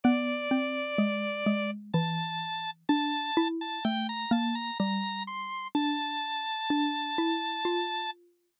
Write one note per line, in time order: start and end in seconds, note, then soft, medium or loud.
0.04 0.48 B3 medium
0.04 1.71 D5 loud
0.51 0.95 C4 medium
0.98 1.44 G#3 medium
1.46 1.91 G#3 medium
1.94 2.84 E3 medium
1.94 2.71 A5 loud
2.89 3.31 D4 medium
2.89 3.48 A5 loud
3.37 3.79 E4 medium
3.61 3.84 A5 loud
3.85 4.26 A3 medium
3.85 4.07 G5 loud
4.09 4.32 A#5 loud
4.31 4.71 A#3 medium
4.31 4.55 A5 loud
4.55 4.78 A#5 loud
4.80 5.68 G3 medium
4.80 5.23 A#5 loud
5.27 5.68 C6 loud
5.75 6.56 D4 medium
5.75 8.11 A5 loud
6.70 7.17 D4 medium
7.18 7.64 E4 medium
7.65 8.58 F4 medium